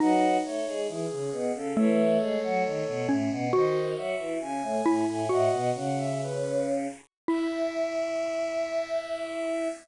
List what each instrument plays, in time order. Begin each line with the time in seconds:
0.00 choir aahs F#3 F#4, xylophone D#4, ocarina B4 D#5
0.44 choir aahs A3 A4, ocarina C#5
0.67 choir aahs G#3 G#4
0.88 choir aahs E3 E4, ocarina G#4
1.10 choir aahs C#3 C#4
1.32 choir aahs B2 B3
1.54 choir aahs C#3 C#4, ocarina A4
1.76 choir aahs E3 E4, xylophone A3, ocarina A4 C#5
2.20 choir aahs G#3 G#4
2.43 choir aahs F#3 F#4
2.65 choir aahs D#3 D#4
2.87 choir aahs B2 B3
3.08 choir aahs A2 A3, xylophone C#4
3.31 choir aahs B2 B3
3.53 choir aahs D#3 D#4, xylophone F#4, ocarina C5 D#5
3.96 choir aahs F#3 F#4, ocarina E5
4.19 choir aahs E3 E4
4.40 choir aahs C#3 C#4, ocarina G#5
4.62 choir aahs A2 A3
4.86 choir aahs A2 A3, xylophone E4
5.07 choir aahs A2 A3, ocarina G#5
5.29 choir aahs A2 A3, xylophone F#4, ocarina D#5 F#5
5.52 choir aahs B2 B3
5.75 choir aahs C#3 C#4, ocarina F#5
5.98 ocarina E5
6.22 ocarina B4
7.28 xylophone E4, choir aahs E4, ocarina E5